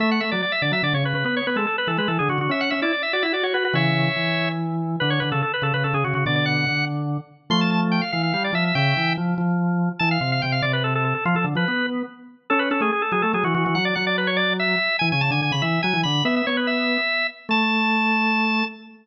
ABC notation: X:1
M:6/8
L:1/16
Q:3/8=96
K:A
V:1 name="Drawbar Organ"
e f e d d e d e d c B B | B c B A A B A B A G F F | e f e d d e d e d c B B | [ce]8 z4 |
B c B A A B A B A G F F | d d f4 z6 | [K:Am] c' a a z g f f f f d e e | [eg]4 z8 |
a f f f g f d B A A A A | F A z B3 z6 | [K:A] A B A G G A G A G F F F | f d f d B c d2 e4 |
g g a g g b e2 g2 b2 | e e c B e6 z2 | a12 |]
V:2 name="Drawbar Organ"
A,2 A, F, z2 D, F, D, C, C, C, | B,2 B, G, z2 E, G, E, D, D, D, | C2 C E z2 F E F F F F | [C,E,]4 E,8 |
D,2 D, C, z2 C, C, C, C, C, C, | [B,,D,]4 D,6 z2 | [K:Am] [F,A,]6 E,2 G,2 F,2 | ^C,2 E,2 F,2 F,6 |
E,2 C,2 C,2 C,6 | F, F, D, F, B,4 z4 | [K:A] C2 C A, z2 F, A, F, E, E, E, | F,2 F,8 z2 |
E, C, C, D, D, C, E,2 F, E, D,2 | B,2 B,6 z4 | A,12 |]